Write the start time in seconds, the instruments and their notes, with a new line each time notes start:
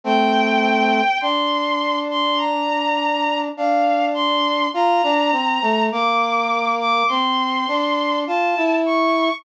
0.04 brass section A3 C4, violin G5
1.21 brass section D4, violin C6
2.10 violin C6
2.38 violin A#5
3.57 brass section D4, violin F5
4.14 violin C6
4.74 brass section F4, violin A#5
5.03 brass section D4
5.32 brass section C4
5.62 brass section A3
5.92 brass section A#3, violin D6
6.79 violin D6
7.08 brass section C4, violin C6
7.68 brass section D4
8.27 brass section F4, violin A5
8.57 brass section E4
8.86 violin C#6